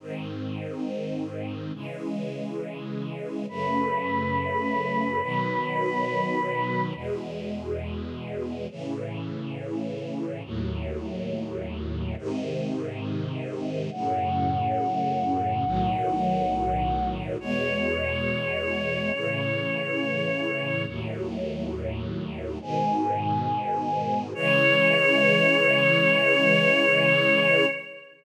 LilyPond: <<
  \new Staff \with { instrumentName = "Choir Aahs" } { \time 4/4 \key cis \minor \tempo 4 = 69 r1 | b'1 | r1 | r1 |
fis''1 | cis''1 | r2 gis''2 | cis''1 | }
  \new Staff \with { instrumentName = "String Ensemble 1" } { \time 4/4 \key cis \minor <gis, dis bis>2 <cis e gis>2 | <fis, cis a>2 <b, dis fis>2 | <e, b, gis>2 <a, cis e>2 | <dis, a, fis>2 <gis, bis, dis>2 |
<fis, a, cis>2 <b,, a, dis fis>2 | <e, b, gis>2 <a, cis e>2 | <dis, a, fis>2 <gis, b, dis>2 | <cis e gis>1 | }
>>